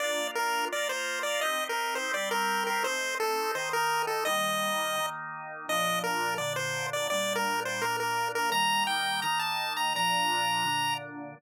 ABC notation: X:1
M:4/4
L:1/16
Q:1/4=169
K:Bb
V:1 name="Lead 1 (square)"
d4 B4 d2 c4 d2 | e3 B3 c2 d2 B4 B2 | c4 A4 c2 B4 A2 | e10 z6 |
e4 B4 d2 c4 d2 | d3 B3 c2 B2 B4 B2 | b4 g4 b2 a4 b2 | b12 z4 |]
V:2 name="Drawbar Organ"
[B,DF]8 [B,FB]8 | [CEG]8 [G,CG]8 | [A,CE]8 [E,A,E]8 | [E,G,B,]8 [E,B,E]8 |
[B,,F,D]8 [B,,D,D]8 | [B,,G,D]8 [B,,B,D]8 | [E,G,B,]8 [E,B,E]8 | [B,,F,D]8 [B,,D,D]8 |]